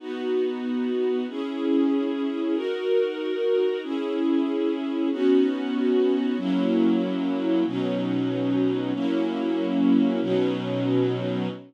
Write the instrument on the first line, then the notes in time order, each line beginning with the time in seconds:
string ensemble 1
0.00 B3 D#4 F#4
1.29 C#4 E4 G#4
2.55 D#4 F#4 A#4
3.83 C#4 E4 G#4
5.11 B3 C#4 D#4 F#4
6.38 F#3 A#3 C#4 E4
7.66 B2 F#3 C#4 D#4
8.94 F#3 A#3 C#4 E4
10.21 B2 F#3 C#4 D#4